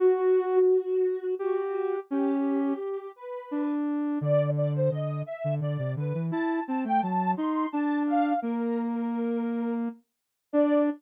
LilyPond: <<
  \new Staff \with { instrumentName = "Ocarina" } { \time 6/8 \key d \mixolydian \tempo 4. = 57 fis'2 fis'4 | g'4. b'4 r8 | d''8 d''16 c''16 dis''8 e''8 d''8 b'8 | a''8 a''16 g''16 a''8 c'''8 a''8 f''8 |
bes'2 r4 | d''4. r4. | }
  \new Staff \with { instrumentName = "Ocarina" } { \time 6/8 \key d \mixolydian fis'4 r4 g'4 | des'4 r4 d'4 | d4 d8 r16 d16 d16 c16 d16 e16 | e'8 c'16 a16 fis8 ees'8 d'4 |
bes2~ bes8 r8 | d'4. r4. | }
>>